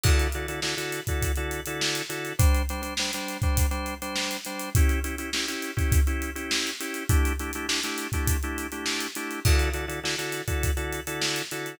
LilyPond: <<
  \new Staff \with { instrumentName = "Drawbar Organ" } { \time 4/4 \key d \major \tempo 4 = 102 <d e' fis' a'>8 <d e' fis' a'>16 <d e' fis' a'>16 <d e' fis' a'>16 <d e' fis' a'>8 <d e' fis' a'>8 <d e' fis' a'>8 <d e' fis' a'>8. <d e' fis' a'>8 | <g d' c''>8 <g d' c''>16 <g d' c''>16 <g d' c''>16 <g d' c''>8 <g d' c''>8 <g d' c''>8 <g d' c''>8. <g d' c''>8 | <cis' e' g'>8 <cis' e' g'>16 <cis' e' g'>16 <cis' e' g'>16 <cis' e' g'>8 <cis' e' g'>8 <cis' e' g'>8 <cis' e' g'>8. <cis' e' g'>8 | <a d' e' g'>8 <a d' e' g'>16 <a d' e' g'>16 <a d' e' g'>16 <a d' e' g'>8 <a d' e' g'>8 <a d' e' g'>8 <a d' e' g'>8. <a d' e' g'>8 |
<d e' fis' a'>8 <d e' fis' a'>16 <d e' fis' a'>16 <d e' fis' a'>16 <d e' fis' a'>8 <d e' fis' a'>8 <d e' fis' a'>8 <d e' fis' a'>8. <d e' fis' a'>8 | }
  \new DrumStaff \with { instrumentName = "Drums" } \drummode { \time 4/4 <cymc bd>16 hh16 hh16 hh16 sn16 hh16 hh16 <hh bd>16 <hh bd>16 hh16 hh16 hh16 sn16 hh16 hh16 hh16 | <hh bd>16 hh16 hh16 hh16 sn16 hh16 hh16 <hh bd>16 <hh bd>16 hh16 hh16 hh16 sn16 hh16 hh16 hh16 | <hh bd>16 hh16 hh16 hh16 sn16 hh16 hh16 <hh bd>16 <hh bd>16 hh16 hh16 hh16 sn16 hh16 hh16 hh16 | <hh bd>16 hh16 hh16 hh16 sn16 hh16 hh16 <hh bd>16 <hh bd>16 hh16 hh16 hh16 sn16 hh16 hh16 hh16 |
<cymc bd>16 hh16 hh16 hh16 sn16 hh16 hh16 <hh bd>16 <hh bd>16 hh16 hh16 hh16 sn16 hh16 hh16 hh16 | }
>>